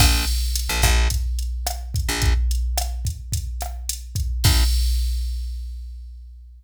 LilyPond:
<<
  \new Staff \with { instrumentName = "Electric Bass (finger)" } { \clef bass \time 4/4 \key bes \minor \tempo 4 = 108 bes,,4~ bes,,16 bes,,16 bes,,2~ bes,,16 bes,,16~ | bes,,1 | bes,,4 r2. | }
  \new DrumStaff \with { instrumentName = "Drums" } \drummode { \time 4/4 <cymc bd ss>8 hh8 hh8 <hh bd ss>8 <hh bd>8 hh8 <hh ss>8 <hh bd>8 | <hh bd>8 hh8 <hh ss>8 <hh bd>8 <hh bd>8 <hh ss>8 hh8 <hh bd>8 | <cymc bd>4 r4 r4 r4 | }
>>